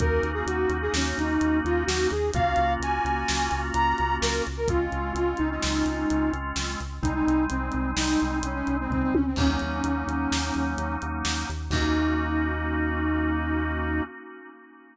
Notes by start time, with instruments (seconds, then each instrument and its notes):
0.00 synth bass 1 D#2, drawbar organ A#3 C#4 D#4 F#4, flute A#4, kick, closed hi-hat
0.23 synth bass 1 D#2, closed hi-hat
0.34 flute G#4
0.46 synth bass 1 D#2, flute F#4, closed hi-hat
0.69 synth bass 1 D#2, closed hi-hat
0.82 flute G#4
0.94 synth bass 1 D#2, flute C#4, snare
1.18 synth bass 1 D#2, flute D#4, closed hi-hat
1.41 synth bass 1 D#2, closed hi-hat
1.65 synth bass 1 D#2, flute F4, closed hi-hat
1.86 synth bass 1 D#2, flute F#4, snare
2.10 synth bass 1 D#2, flute G#4, closed hi-hat
2.34 synth bass 1 C#2, drawbar organ A#3 C#4 F4 F#4, flute F5, kick, closed hi-hat
2.56 synth bass 1 C#2, closed hi-hat
2.80 synth bass 1 C#2, flute G#5, closed hi-hat
3.04 synth bass 1 C#2, closed hi-hat
3.28 synth bass 1 C#2, snare
3.51 synth bass 1 C#2, closed hi-hat
3.74 synth bass 1 C#2, flute A#5, closed hi-hat
3.98 synth bass 1 C#2, closed hi-hat
4.21 synth bass 1 C#2, flute A#4, snare
4.47 synth bass 1 C#2, closed hi-hat
4.57 flute A#4
4.68 synth bass 1 C#2, drawbar organ G#3 C4 C#4 F4, flute F4, kick, closed hi-hat
4.92 synth bass 1 C#2, closed hi-hat
5.15 synth bass 1 C#2, flute F4, closed hi-hat
5.37 synth bass 1 C#2, flute D#4, closed hi-hat
5.51 flute D#4
5.62 synth bass 1 C#2, snare
5.85 synth bass 1 C#2, closed hi-hat
6.10 synth bass 1 C#2, closed hi-hat
6.33 synth bass 1 C#2, closed hi-hat
6.56 synth bass 1 C#2, snare
6.80 synth bass 1 C#2, closed hi-hat
7.03 synth bass 1 C2, drawbar organ G3 G#3 C4 D#4, flute D#4, kick, closed hi-hat
7.14 flute D#4
7.27 synth bass 1 C2, closed hi-hat
7.50 synth bass 1 C2, flute C4, closed hi-hat
7.72 synth bass 1 C2, closed hi-hat
7.97 synth bass 1 C2, flute D#4, snare
8.20 synth bass 1 C2, closed hi-hat
8.43 synth bass 1 C2, flute C#4, closed hi-hat
8.54 flute C#4
8.67 synth bass 1 C2, closed hi-hat
8.80 flute C4
8.90 synth bass 1 C#2, flute C4, kick, floor tom
9.02 flute C4
9.14 synth bass 1 D2, flute C#4, high tom
9.27 flute C4
9.36 synth bass 1 D#2, drawbar organ F#3 A#3 C#4 D#4, flute C#4, kick, crash
9.59 synth bass 1 D#2, closed hi-hat
9.84 synth bass 1 D#2, closed hi-hat
10.07 synth bass 1 D#2, closed hi-hat
10.32 synth bass 1 D#2, snare
10.54 synth bass 1 D#2, closed hi-hat
10.78 synth bass 1 D#2, closed hi-hat
11.02 synth bass 1 D#2, closed hi-hat
11.25 synth bass 1 D#2, snare
11.49 synth bass 1 D#2, closed hi-hat
11.70 synth bass 1 D#2, drawbar organ A#3 C#4 D#4 F#4, flute D#4, kick, crash